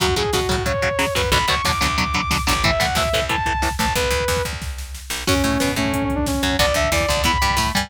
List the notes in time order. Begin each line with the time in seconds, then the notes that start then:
0.00 F#2 C#3 F#3 F#4, kick, closed hi-hat
0.08 kick
0.16 A2 C#3 F#3 G#4, kick, closed hi-hat
0.25 kick
0.33 B2 C#3 F#3 F#4, kick, snare
0.41 kick
0.49 A2 C#3 F#3, kick, closed hi-hat
0.58 kick
0.66 C#3 F#3 C#5, kick, closed hi-hat
0.74 kick
0.82 C#3 F#3, kick, closed hi-hat
0.91 kick
0.99 C#3 F#3, kick, snare
1.07 kick
1.15 F#2 C#3 F#3 B4, kick, open hi-hat
1.24 kick
1.32 B1 B2 D3 F#3 B5, kick, closed hi-hat
1.40 kick
1.48 D2 B2 D3 F#3 C#6, kick, closed hi-hat
1.56 kick
1.64 E2 B2 D3 F#3 D6, kick, snare
1.73 kick
1.81 D2 B2 D3 F#3, kick, closed hi-hat
1.90 kick
1.98 B2 D3 F#3 D6, kick, closed hi-hat
2.06 kick
2.14 B2 D3 F#3, kick, closed hi-hat
2.23 kick
2.30 B2 D3 F#3, kick, snare
2.39 kick
2.47 A1 B2 D3 F#3 D6, kick, closed hi-hat
2.56 kick
2.64 A2 E3 E5, kick, closed hi-hat
2.72 kick
2.80 C2 A2 E3 F#5, kick, closed hi-hat
2.88 kick
2.95 D2 A2 E3 E5, kick, snare
3.05 kick
3.13 C2 A2 E3, kick, closed hi-hat
3.22 kick
3.29 A2 E3 A5, kick, closed hi-hat
3.38 kick
3.46 A2 E3, kick, closed hi-hat
3.54 kick
3.62 A2 E3, kick, snare
3.71 kick
3.79 A1 A2 E3 A5, kick, closed hi-hat
3.87 kick
3.95 B1 B4, kick, closed hi-hat
4.04 kick
4.11 D2, kick, closed hi-hat
4.20 kick
4.28 E2, kick, snare
4.37 kick
4.45 D2, kick, closed hi-hat
4.53 kick
4.62 kick, snare
4.78 snare
4.95 snare
5.10 B1, snare
5.27 F#2 C#4 F#4, kick, crash
5.36 kick
5.44 A2 A3, kick, closed hi-hat
5.52 kick
5.60 B2 B3, kick, snare
5.68 kick
5.76 A2 A3 C#4, kick, closed hi-hat
5.85 kick
5.93 C#4, kick, closed hi-hat
6.02 C#4, kick
6.10 kick, closed hi-hat
6.15 D4, kick
6.26 C#4, kick, snare
6.34 kick
6.43 F#2 F#3, kick, closed hi-hat
6.51 kick
6.59 B1 B3 D4 F#4 D5, kick, closed hi-hat
6.68 kick
6.74 D2 D3 E5, kick, closed hi-hat
6.84 kick
6.92 E2 E3 D5, kick, snare
7.00 kick
7.08 D2 D3, kick, closed hi-hat
7.17 kick
7.24 E2 B3 E4 B5, kick, closed hi-hat
7.34 kick
7.42 G2 G3, kick, closed hi-hat
7.50 kick
7.57 A2 A3, kick, snare
7.66 kick
7.75 G2 G3 G#5, kick, closed hi-hat
7.83 kick